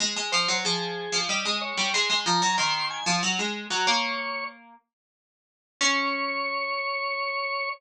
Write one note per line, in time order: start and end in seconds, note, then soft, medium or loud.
0.00 0.16 G#3 medium
0.16 0.32 G#3 medium
0.32 0.48 F3 medium
0.32 0.58 C5 medium
0.48 0.64 F#3 medium
0.65 1.08 F3 medium
0.65 1.19 G#4 medium
1.12 1.28 F3 medium
1.29 1.44 G3 medium
1.29 1.59 D#5 medium
1.45 1.73 G#3 medium
1.61 1.90 C#5 medium
1.77 1.93 G3 medium
1.94 2.09 G#3 medium
1.94 2.20 C6 medium
2.10 2.25 G#3 medium
2.26 2.41 F3 medium
2.26 2.55 A#5 medium
2.42 2.57 F#3 medium
2.58 3.00 D#3 medium
2.58 2.86 C6 medium
2.90 3.06 G#5 medium
3.06 3.22 F3 medium
3.23 3.38 F#3 medium
3.39 3.66 G#3 medium
3.70 3.86 F#3 medium
3.70 3.86 F#5 medium
3.87 4.73 A#3 medium
3.87 4.44 C#5 medium
5.81 7.69 C#4 loud
5.81 7.69 C#5 loud